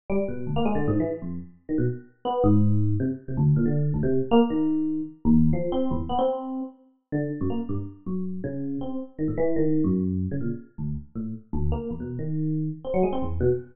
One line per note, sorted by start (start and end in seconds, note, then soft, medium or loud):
0.10 0.18 G3 loud
0.28 0.45 B2 medium
0.47 0.55 D2 medium
0.56 0.65 A#3 loud
0.65 0.74 G#3 loud
0.75 0.86 D3 medium
0.88 0.99 G#2 loud
1.00 1.11 E3 medium
1.22 1.39 F2 medium
1.69 1.77 D#3 medium
1.78 1.86 B2 medium
2.25 2.42 B3 medium
2.44 2.94 G#2 loud
3.00 3.08 C3 medium
3.28 3.37 C3 medium
3.37 3.54 D2 loud
3.56 3.65 A#2 medium
3.66 3.91 D3 medium
3.94 4.02 D2 medium
4.03 4.20 C3 loud
4.31 4.40 A#3 loud
4.50 5.01 D#3 medium
5.25 5.50 D#2 loud
5.53 5.70 F3 medium
5.72 5.89 C4 medium
5.91 5.99 E2 loud
6.09 6.18 B3 medium
6.19 6.61 C4 medium
7.12 7.29 D3 medium
7.41 7.49 F#2 medium
7.50 7.59 A#3 medium
7.69 7.77 G2 medium
8.06 8.40 F#2 medium
8.44 8.78 C#3 medium
8.81 8.98 C4 medium
9.19 9.27 D#3 medium
9.28 9.36 A2 medium
9.38 9.54 E3 loud
9.56 9.82 D#3 medium
9.84 10.26 F#2 medium
10.31 10.40 C#3 medium
10.41 10.49 A#2 medium
10.78 10.95 D2 medium
11.15 11.32 A2 medium
11.53 11.70 D2 loud
11.72 11.89 A#3 medium
11.91 11.99 E2 medium
12.00 12.17 B2 medium
12.19 12.69 D#3 medium
12.85 12.93 C4 medium
12.94 13.02 F#3 medium
13.03 13.12 G#3 medium
13.13 13.21 C4 medium
13.22 13.39 E2 medium
13.41 13.49 B2 loud